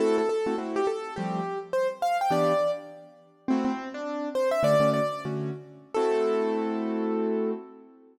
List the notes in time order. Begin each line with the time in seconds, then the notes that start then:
0.00 A3 C4 E4 F#4 A4
0.18 A4
0.29 A4
0.46 A3 C4 E4 F#4
0.58 A3 C4 E4 F#4
0.76 G4
0.87 A4
1.16 F3 G3 A3 C4 G4
1.73 C5
2.02 F5
2.21 G5
2.30 E3 B3 D4 G4 D5
3.48 A3 C4 E4 F#4
3.65 C4
3.94 D4
4.35 C5
4.51 E5
4.63 D3 A3 C#4 F#4 D5
4.80 D3 A3 C#4 F#4
4.94 D5
5.25 D3 A3 C#4 F#4
5.94 A3 C4 E4 F#4 A4